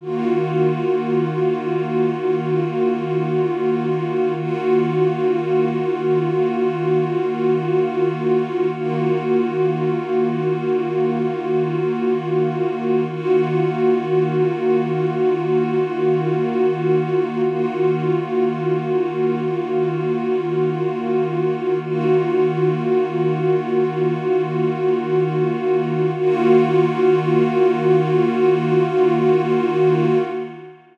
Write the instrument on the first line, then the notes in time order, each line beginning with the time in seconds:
pad 2 (warm)
0.01 D#3 A#3 F4 F#4
4.36 D#3 A#3 F4 F#4
8.73 D#3 A#3 F4 F#4
13.09 D#3 A#3 F4 F#4
17.45 D#3 A#3 F4 F#4
21.82 D#3 A#3 F4 F#4
26.18 D#3 A#3 F4 F#4